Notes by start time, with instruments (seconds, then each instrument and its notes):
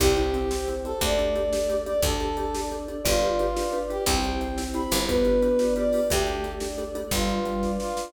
0.00 electric bass (finger) C2, marimba C4 E4 G4, choir aahs C4 E4 G4, vibraphone G4, brass section G4, kick, crash
0.17 marimba C4 E4 G4, closed hi-hat
0.34 marimba C4 E4 G4, closed hi-hat
0.51 marimba C4 E4 G4, choir aahs C4 G4 C5, snare
0.68 marimba C4 E4 G4, closed hi-hat
0.85 marimba C4 E4 G4, brass section A4, closed hi-hat
1.01 electric bass (finger) D2, vibraphone A3, marimba D4 G4 A4, choir aahs D4 G4 A4, brass section D5, kick, closed hi-hat
1.19 marimba D4 G4 A4, closed hi-hat
1.35 marimba D4 G4 A4, closed hi-hat
1.52 choir aahs D4 A4 D5, marimba D4 G4 A4, snare
1.69 marimba D4 G4 A4, closed hi-hat
1.86 marimba D4 G4 A4, brass section D5, closed hi-hat
2.02 electric bass (finger) D2, choir aahs D4 G4 A4, vibraphone D4, marimba D4 G4 A4, brass section A4, kick, closed hi-hat
2.20 marimba D4 G4 A4, closed hi-hat
2.37 marimba D4 G4 A4, closed hi-hat
2.54 marimba D4 G4 A4, choir aahs D4 A4 D5, snare
2.71 marimba D4 G4 A4, closed hi-hat
2.88 marimba D4 G4 A4, closed hi-hat
3.05 electric bass (finger) G1, marimba D4 F4 G4 B4, choir aahs D4 F4 G4 B4, brass section F4, vibraphone D5, kick, closed hi-hat
3.22 marimba D4 F4 G4 B4, closed hi-hat
3.39 marimba D4 F4 G4 B4, closed hi-hat
3.56 marimba D4 F4 G4 B4, choir aahs D4 F4 B4 D5, snare
3.73 marimba D4 F4 G4 B4, closed hi-hat
3.90 marimba D4 F4 G4 B4, brass section G4, closed hi-hat
4.06 electric bass (finger) C2, vibraphone C4, marimba E4 G4 C5, choir aahs E4 G4 C5, brass section G5, kick, closed hi-hat
4.24 marimba E4 G4 C5, closed hi-hat
4.41 marimba E4 G4 C5, closed hi-hat
4.57 choir aahs C4 E4 C5, marimba E4 G4 C5, snare
4.74 marimba E4 G4 C5, brass section B5, closed hi-hat
4.91 electric bass (finger) G1, marimba E4 G4 C5, closed hi-hat
5.08 vibraphone B3, marimba D4 F4 G4 B4, choir aahs D4 F4 G4 B4, brass section B4, kick, closed hi-hat
5.25 marimba D4 F4 G4 B4, closed hi-hat
5.42 marimba D4 F4 G4 B4, closed hi-hat
5.59 marimba D4 F4 G4 B4, choir aahs D4 F4 B4 D5, snare
5.76 marimba D4 F4 G4 B4, brass section D5, closed hi-hat
5.93 marimba D4 F4 G4 B4, open hi-hat
6.10 electric bass (finger) D2, vibraphone A3, choir aahs D4 G4 A4, marimba D4 G4 A4, brass section G4, kick, closed hi-hat
6.27 marimba D4 G4 A4, closed hi-hat
6.44 marimba D4 G4 A4, closed hi-hat
6.60 marimba D4 G4 A4, choir aahs D4 A4 D5, snare
6.78 marimba D4 G4 A4, closed hi-hat
6.95 marimba D4 G4 A4, closed hi-hat
7.11 electric bass (finger) G1, vibraphone G3, choir aahs D4 F4 G4 B4, brass section F4, kick, closed hi-hat
7.29 closed hi-hat
7.45 vibraphone G3, closed hi-hat
7.62 choir aahs D4 F4 B4 D5, kick, snare
7.80 brass section F4, snare
7.97 snare